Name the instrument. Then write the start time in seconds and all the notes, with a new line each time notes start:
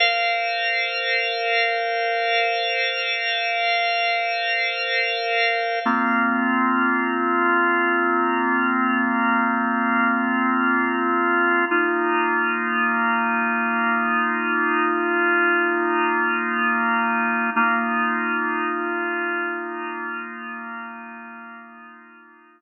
drawbar organ
0.00 A#4 C5 F5
5.86 A#3 C4 F4
11.71 A#3 D#4 F4
17.56 A#3 D#4 F4